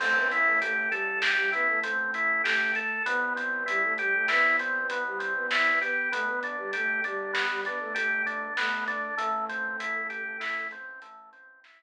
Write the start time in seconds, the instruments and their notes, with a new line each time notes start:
0.00 synth bass 1 A1, flute A3 A4, drawbar organ C4, kick, crash
0.15 flute B3 B4
0.31 drawbar organ E4, closed hi-hat
0.46 flute A3 A4
0.61 flute A3 A4, drawbar organ G4, closed hi-hat
0.90 flute G3 G4, drawbar organ A4, closed hi-hat
1.22 drawbar organ G4, snare
1.37 flute G3 G4
1.52 flute B3 B4, drawbar organ E4, closed hi-hat
1.68 flute A3 A4
1.83 flute A3 A4, drawbar organ C4, closed hi-hat
2.14 drawbar organ E4, closed hi-hat
2.44 flute A3 A4, drawbar organ G4, snare
2.75 drawbar organ A4, closed hi-hat
3.06 synth bass 1 C2, drawbar organ B3, flute B3 B4, kick, closed hi-hat
3.36 drawbar organ C4, closed hi-hat
3.66 flute G3 G4, drawbar organ E4, closed hi-hat
3.84 flute A3 A4
3.98 flute G3 G4, drawbar organ G4, closed hi-hat
4.14 flute A3 A4
4.28 flute B3 B4, drawbar organ E4, snare
4.59 drawbar organ C4, closed hi-hat
4.89 flute B3 B4, drawbar organ B3, closed hi-hat
5.06 flute G3 G4
5.19 drawbar organ C4, closed hi-hat
5.35 flute B3 B4
5.51 drawbar organ E4, snare
5.81 flute B3 B4, drawbar organ G4, closed hi-hat
6.12 synth bass 1 G1, flute A3 A4, drawbar organ B3, kick, closed hi-hat
6.27 flute B3 B4
6.43 drawbar organ D4, closed hi-hat
6.58 flute G3 G4
6.73 flute A3 A4, drawbar organ G4, closed hi-hat
7.04 flute G3 G4, drawbar organ D4, closed hi-hat
7.33 drawbar organ B3, snare
7.50 flute G3 G4
7.65 flute B3 B4, drawbar organ D4, closed hi-hat
7.80 flute A3 A4
7.95 flute A3 A4, drawbar organ G4, closed hi-hat
8.26 drawbar organ D4, closed hi-hat
8.57 flute A3 A4, drawbar organ B3, snare
8.88 drawbar organ D4, closed hi-hat
9.17 synth bass 1 A1, drawbar organ A3, flute A3 A4, kick, closed hi-hat
9.49 drawbar organ C4, closed hi-hat
9.80 drawbar organ E4, closed hi-hat
10.10 drawbar organ G4, closed hi-hat
10.40 drawbar organ E4, snare
10.71 drawbar organ C4, closed hi-hat
11.02 drawbar organ A3, closed hi-hat
11.33 drawbar organ C4, closed hi-hat
11.64 drawbar organ E4, snare